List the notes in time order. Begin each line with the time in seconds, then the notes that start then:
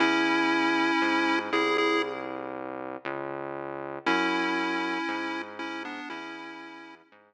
0.00 E2 C#4 E4
1.02 G#2
1.53 C2 E4 G#4
1.78 E4 G#4
3.05 C#2
4.06 F#2 C#4 E4
5.08 G#2
5.59 C#4 E4
5.85 B3 D4
6.10 E2 C#4 E4
7.12 G#2